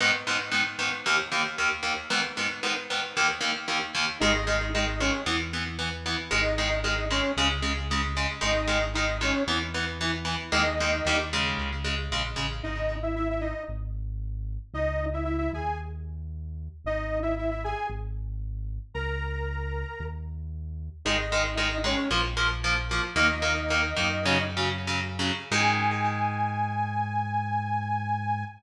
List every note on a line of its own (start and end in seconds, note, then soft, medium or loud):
0.00 0.11 G#2 medium
0.00 0.11 D#3 medium
0.00 0.11 B3 medium
0.27 0.37 G#2 medium
0.27 0.37 D#3 medium
0.27 0.37 B3 medium
0.52 0.62 G#2 medium
0.52 0.62 D#3 medium
0.52 0.62 B3 medium
0.79 0.89 G#2 medium
0.79 0.89 D#3 medium
0.79 0.89 B3 medium
1.06 1.16 D#2 medium
1.06 1.16 D#3 medium
1.06 1.16 A#3 medium
1.32 1.42 D#2 medium
1.32 1.42 D#3 medium
1.32 1.42 A#3 medium
1.58 1.69 D#2 medium
1.58 1.69 D#3 medium
1.58 1.69 A#3 medium
1.83 1.93 D#2 medium
1.83 1.93 D#3 medium
1.83 1.93 A#3 medium
2.10 2.21 G#2 medium
2.10 2.21 D#3 medium
2.10 2.21 B3 medium
2.37 2.48 G#2 medium
2.37 2.48 D#3 medium
2.37 2.48 B3 medium
2.63 2.73 G#2 medium
2.63 2.73 D#3 medium
2.63 2.73 B3 medium
2.90 3.01 G#2 medium
2.90 3.01 D#3 medium
2.90 3.01 B3 medium
3.17 3.27 D#2 medium
3.17 3.27 D#3 medium
3.17 3.27 A#3 medium
3.41 3.51 D#2 medium
3.41 3.51 D#3 medium
3.41 3.51 A#3 medium
3.68 3.78 D#2 medium
3.68 3.78 D#3 medium
3.68 3.78 A#3 medium
3.95 4.05 D#2 medium
3.95 4.05 D#3 medium
3.95 4.05 A#3 medium
4.20 5.11 G#1 loud
4.20 4.32 D#3 medium
4.20 4.32 G#3 loud
4.20 4.69 D#4 medium
4.20 4.69 D#5 medium
4.47 4.57 D#3 medium
4.47 4.57 G#3 medium
4.74 4.85 D#3 medium
4.74 4.85 G#3 medium
4.74 5.00 D#4 medium
4.74 5.00 D#5 medium
5.00 5.11 D#3 medium
5.00 5.11 G#3 medium
5.00 5.22 C#4 medium
5.00 5.22 C#5 medium
5.26 6.16 E2 medium
5.26 5.37 E3 medium
5.26 5.37 B3 medium
5.53 5.64 E3 medium
5.53 5.64 B3 medium
5.79 5.89 E3 medium
5.79 5.89 B3 medium
6.06 6.16 E3 medium
6.06 6.16 B3 medium
6.31 7.21 G#1 loud
6.31 6.41 D#3 medium
6.31 6.41 G#3 medium
6.31 6.76 D#4 medium
6.31 6.76 D#5 medium
6.58 6.69 D#3 medium
6.58 6.69 G#3 medium
6.83 6.95 D#3 medium
6.83 6.95 G#3 medium
6.83 7.05 D#4 medium
6.83 7.05 D#5 medium
7.11 7.21 D#3 medium
7.11 7.21 G#3 medium
7.11 7.32 C#4 medium
7.11 7.32 C#5 medium
7.37 8.26 C#2 loud
7.37 7.48 C#3 medium
7.37 7.48 G#3 medium
7.62 7.73 C#3 medium
7.62 7.73 G#3 medium
7.91 8.02 C#3 medium
7.91 8.02 G#3 medium
8.17 8.27 C#3 medium
8.17 8.27 G#3 medium
8.41 9.32 G#1 loud
8.41 8.52 D#3 medium
8.41 8.52 G#3 medium
8.41 8.86 D#4 medium
8.41 8.86 D#5 medium
8.67 8.78 D#3 medium
8.67 8.78 G#3 medium
8.94 9.06 D#3 medium
8.94 9.06 G#3 medium
8.94 9.18 D#4 medium
8.94 9.18 D#5 medium
9.21 9.32 D#3 medium
9.21 9.32 G#3 medium
9.21 9.43 C#4 medium
9.21 9.43 C#5 medium
9.47 10.37 E2 medium
9.47 9.58 E3 medium
9.47 9.58 B3 medium
9.74 9.85 E3 medium
9.74 9.85 B3 medium
10.01 10.11 E3 medium
10.01 10.11 B3 medium
10.25 10.35 E3 medium
10.25 10.35 B3 medium
10.52 11.01 D#2 loud
10.52 10.63 D#3 medium
10.52 10.63 G#3 medium
10.52 10.63 A#3 medium
10.52 11.15 D#4 medium
10.52 11.15 D#5 medium
10.80 10.91 D#3 medium
10.80 10.91 G#3 medium
10.80 10.91 A#3 medium
11.05 11.54 D#2 medium
11.05 11.17 D#3 medium
11.05 11.17 G3 medium
11.05 11.17 A#3 medium
11.33 11.70 C#3 medium
11.33 11.70 G#3 medium
11.58 12.08 C#2 loud
11.84 11.95 C#3 medium
11.84 11.95 G#3 medium
12.11 12.34 A#1 medium
12.11 12.22 C#3 medium
12.11 12.22 G#3 medium
12.36 12.61 A1 medium
12.36 12.47 C#3 medium
12.36 12.47 G#3 medium
12.63 13.53 G#1 medium
12.63 12.96 D#4 medium
12.63 12.96 D#5 medium
13.03 13.15 E4 medium
13.03 13.15 E5 medium
13.16 13.28 E4 medium
13.16 13.28 E5 medium
13.30 13.43 E4 medium
13.30 13.43 E5 medium
13.41 13.63 D#4 medium
13.41 13.63 D#5 medium
13.68 14.58 G#1 loud
14.74 15.49 C#2 loud
14.74 15.06 D#4 medium
14.74 15.06 D#5 medium
15.13 15.24 E4 medium
15.13 15.24 E5 medium
15.25 15.37 E4 medium
15.25 15.37 E5 medium
15.38 15.51 E4 medium
15.38 15.51 E5 medium
15.53 16.68 D#2 loud
15.53 15.78 G#4 medium
15.53 15.78 G#5 medium
16.84 17.74 G#1 medium
16.84 17.19 D#4 medium
16.84 17.19 D#5 medium
17.22 17.35 E4 medium
17.22 17.35 E5 medium
17.38 17.50 E4 medium
17.38 17.50 E5 medium
17.51 17.63 E4 medium
17.51 17.63 E5 medium
17.64 17.87 G#4 medium
17.64 17.87 G#5 medium
17.90 18.79 G#1 loud
18.94 19.84 C#2 loud
18.94 20.05 A#4 medium
18.94 20.05 A#5 medium
20.00 20.89 D#2 loud
21.05 21.95 G#1 medium
21.05 21.16 D#3 medium
21.05 21.16 G#3 medium
21.05 21.55 D#4 medium
21.05 21.55 D#5 medium
21.32 21.43 D#3 medium
21.32 21.43 G#3 medium
21.56 21.68 D#3 medium
21.56 21.68 G#3 medium
21.56 21.78 D#4 medium
21.56 21.78 D#5 medium
21.84 21.95 D#3 medium
21.84 21.95 G#3 medium
21.84 22.09 C#4 medium
21.84 22.09 C#5 medium
22.10 23.00 A#1 loud
22.10 22.21 F3 medium
22.10 22.21 A#3 medium
22.37 22.47 F3 medium
22.37 22.47 A#3 medium
22.64 22.75 F3 medium
22.64 22.75 A#3 medium
22.91 23.02 F3 medium
22.91 23.02 A#3 medium
23.16 23.93 D#2 loud
23.16 23.26 D#3 medium
23.16 23.26 A#3 medium
23.16 24.43 D#4 medium
23.16 24.43 D#5 medium
23.42 23.53 D#3 medium
23.42 23.53 A#3 medium
23.70 23.81 D#3 medium
23.70 23.81 A#3 medium
23.97 25.31 F#2 loud
23.97 24.08 D#3 medium
23.97 24.08 A#3 medium
24.25 24.37 C#3 loud
24.25 24.37 F#3 loud
24.57 24.69 C#3 medium
24.57 24.69 F#3 medium
24.87 25.00 C#3 medium
24.87 25.00 F#3 medium
25.19 25.32 C#3 medium
25.19 25.32 F#3 medium
25.51 28.44 G#2 loud
25.51 28.44 D#3 loud
25.51 28.44 G#3 loud
25.51 28.45 G#5 loud